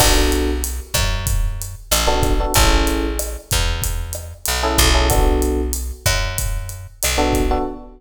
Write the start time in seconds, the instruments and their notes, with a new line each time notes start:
0.00 electric bass (finger) B1, electric piano 1 B3 D4 F#4 A4, kick, cross-stick, crash
0.32 closed hi-hat
0.64 closed hi-hat
0.94 electric bass (finger) F#2, kick, cross-stick, closed hi-hat
1.27 kick, closed hi-hat
1.62 closed hi-hat
1.91 electric bass (finger) A1, cross-stick, closed hi-hat
2.07 electric piano 1 B3 D4 F#4 A4
2.23 kick, closed hi-hat
2.40 electric piano 1 B3 D4 F#4 A4
2.54 electric bass (finger) A1, electric piano 1 C#4 E4 G#4 A4, kick, closed hi-hat
2.87 closed hi-hat
3.19 cross-stick, closed hi-hat
3.51 electric bass (finger) E2, kick, closed hi-hat
3.82 kick, closed hi-hat
4.13 cross-stick, closed hi-hat
4.45 electric bass (finger) B1, closed hi-hat
4.63 electric piano 1 C#4 E4 G#4 A4
4.78 electric bass (finger) B1, kick, closed hi-hat
4.94 electric piano 1 C#4 E4 G#4 A4
5.10 electric piano 1 B3 D4 F#4 A4, kick, cross-stick, closed hi-hat
5.42 closed hi-hat
5.73 closed hi-hat
6.06 electric bass (finger) F#2, kick, cross-stick, closed hi-hat
6.38 kick, closed hi-hat
6.69 closed hi-hat
7.03 electric bass (finger) B1, cross-stick, closed hi-hat
7.18 electric piano 1 B3 D4 F#4 A4
7.33 kick, closed hi-hat
7.51 electric piano 1 B3 D4 F#4 A4